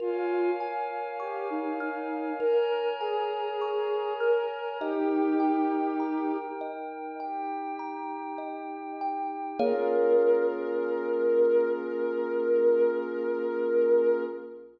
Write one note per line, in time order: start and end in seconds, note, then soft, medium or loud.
0.00 0.51 F4 medium
0.00 0.53 A#4 medium
0.00 2.38 A#4 medium
0.00 2.38 C#5 medium
0.00 2.38 F5 medium
0.00 2.38 G#5 medium
0.60 1.14 G#5 medium
1.20 1.49 G4 medium
1.20 1.74 C#6 medium
1.50 1.78 D#4 medium
1.80 2.32 D#4 medium
1.80 2.34 F6 medium
2.40 2.93 A#4 medium
2.40 2.94 A#4 medium
2.40 4.78 A#4 medium
2.40 4.78 C#5 medium
2.40 4.78 G#5 medium
2.40 4.78 A#5 medium
3.00 4.13 G#4 medium
3.00 3.55 G#5 medium
3.62 4.16 C#6 medium
4.20 4.78 A#4 medium
4.20 4.74 F6 medium
4.80 6.37 D#4 medium
4.80 7.17 D#4 medium
4.80 6.37 G4 loud
4.80 7.17 A#4 medium
4.80 5.35 D#5 medium
4.80 7.17 G5 medium
5.40 5.94 G5 medium
6.00 6.54 A#5 medium
6.61 7.15 D#5 medium
7.20 9.58 D#4 medium
7.20 9.58 G4 medium
7.20 7.74 G5 medium
7.20 9.58 G5 medium
7.79 8.33 A#5 medium
8.38 8.92 D#5 medium
9.01 9.55 G5 medium
9.59 14.23 A#3 loud
9.59 14.24 A#3 loud
9.59 14.24 C#4 medium
9.59 14.24 F4 loud
9.59 14.23 G#4 loud
9.59 14.24 G#4 loud
9.59 14.24 A#4 loud
9.59 14.23 C#5 loud
9.59 14.23 F5 loud